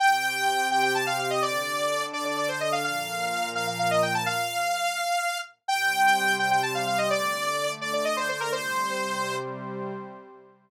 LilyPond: <<
  \new Staff \with { instrumentName = "Lead 2 (sawtooth)" } { \time 4/4 \key c \dorian \tempo 4 = 169 g''2 \tuplet 3/2 { g''8 g''8 a''8 f''8 f''8 ees''8 } | d''2 \tuplet 3/2 { d''8 d''8 d''8 c''8 ees''8 f''8 } | f''2 \tuplet 3/2 { f''8 f''8 f''8 ees''8 g''8 a''8 } | f''2.~ f''8 r8 |
g''2 \tuplet 3/2 { g''8 g''8 a''8 f''8 f''8 ees''8 } | d''2 \tuplet 3/2 { d''8 d''8 ees''8 c''8 c''8 bes'8 } | c''2~ c''8 r4. | }
  \new Staff \with { instrumentName = "Pad 2 (warm)" } { \time 4/4 \key c \dorian <c c' g'>1 | <d d' a'>1 | <bes, f bes'>1 | r1 |
<c g c''>1 | <d a d''>1 | <c g c''>1 | }
>>